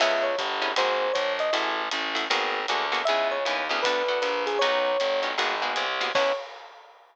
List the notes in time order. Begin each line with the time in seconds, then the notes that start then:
0.00 C#2 B3 C#4 E4 G#4 E5, crash, ride
0.23 C#5
0.38 G1, kick, hi-hat pedal, ride
0.62 B3 C#4 E4 G#4, ride
0.76 G#1 A#3 C4 F#4 G#4 C5, ride
1.13 A#1 C#5, kick, hi-hat pedal, ride
1.39 D#5, ride
1.53 A1 A3 E4 F#4 G#4, ride
1.91 A1, hi-hat pedal, ride
2.15 A3 E4 F#4 G#4, ride
2.30 G#1 A#3 B3 F#4 G#4, ride
2.68 D2 A#3 B3 F#4 G#4, hi-hat pedal, ride
2.92 A#3 B3 F#4 G#4, ride
3.05 C#2 B3 C#4 E4 G#4 E5, ride
3.31 C#5
3.45 D#2 B3 C#4 E4 G#4, hi-hat pedal, ride
3.69 D2 B3 C#4 E4 G#4, ride
3.82 B3 D4 F#4 A4 B4, kick, ride
4.08 B3 D4 F#4 A4
4.22 A#1 B4, hi-hat pedal, ride
4.47 G#4, ride
4.59 B1 B3 C#4 D#4 F#4 C#5, ride
5.00 G1, hi-hat pedal, ride
5.23 B3 C#4 D#4 F#4, ride
5.38 G#1 A#3 B3 F#4 G#4, ride
5.62 A#3 B3 F#4 G#4
5.76 C2, hi-hat pedal, ride
6.01 A#3 B3 F#4 G#4, ride
6.15 C#2 B3 C#4 E4 G#4 C#5, kick, crash